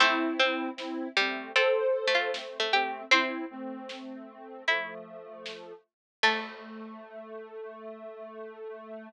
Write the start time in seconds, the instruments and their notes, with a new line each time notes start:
0.00 harpsichord A3 C4 C5, ocarina C4 E4, kick, closed hi-hat
0.39 harpsichord C4 C5
0.77 ocarina C4 E4, snare
1.17 harpsichord G3, ocarina A3 C4
1.56 harpsichord C4 A4 A5, ocarina A4 C5, closed hi-hat
2.07 harpsichord A3
2.14 harpsichord F4 F5
2.34 ocarina A3 C4, snare
2.60 harpsichord A3
2.73 ocarina A3 C4, harpsichord G4 G5
3.11 harpsichord C4 C5 C6, ocarina C4 E4, kick, closed hi-hat
3.50 ocarina A3 C4
3.89 snare
4.67 ocarina F3 A3, harpsichord E4 E5, closed hi-hat
5.46 snare
6.23 harpsichord A3 A5, ocarina A3, kick, crash